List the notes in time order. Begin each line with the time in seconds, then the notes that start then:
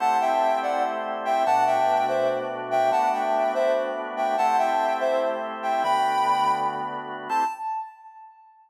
0.00 A3 C4 E4 G4 F#5 A5
0.21 E5 G5
0.63 D5 F#5
1.25 E5 G5
1.46 B2 A3 D4 F#4 F#5 A5
1.67 E5 G5
2.08 C5 E5
2.71 E5 G5
2.91 A3 B3 D4 F#4 F#5 A5
3.13 E5 G5
3.54 C5 E5
4.17 E5 G5
4.38 A3 C4 E4 G4 F#5 A5
4.58 E5 G5
5.00 C5 E5
5.63 E5 G5
5.83 D3 A3 B3 F#4 G5 B5
7.29 A3 C4 E4 G4 A5